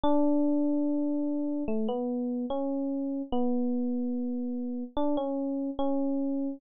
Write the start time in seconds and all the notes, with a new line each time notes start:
0.04 D4
1.68 A3
1.89 B3
2.50 C#4
3.32 B3
4.97 D4
5.17 C#4
5.79 C#4